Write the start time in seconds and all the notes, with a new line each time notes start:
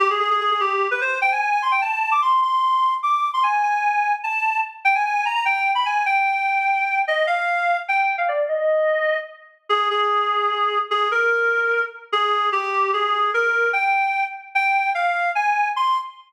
0.00 G4
0.10 G#4
0.20 G#4
0.31 G#4
0.41 G#4
0.51 G#4
0.60 G4
0.91 B4
1.01 C5
1.22 G5
1.32 G#5
1.41 G#5
1.52 G#5
1.62 C6
1.72 G5
1.82 A5
2.11 D6
2.22 C6
2.42 C6
3.03 D6
3.34 C6
3.43 G#5
3.63 G#5
4.24 A5
4.85 G5
4.95 G#5
5.06 G#5
5.15 G#5
5.25 A#5
5.35 A#5
5.45 G5
5.75 B5
5.86 G#5
6.06 G5
7.08 D#5
7.27 F5
7.88 G5
8.18 F5
8.28 D5
8.48 D#5
9.69 G#4
9.90 G#4
10.91 G#4
11.11 A#4
12.12 G#4
12.52 G4
12.93 G#4
13.34 A#4
13.73 G5
14.55 G5
14.95 F5
15.35 G#5
15.76 C6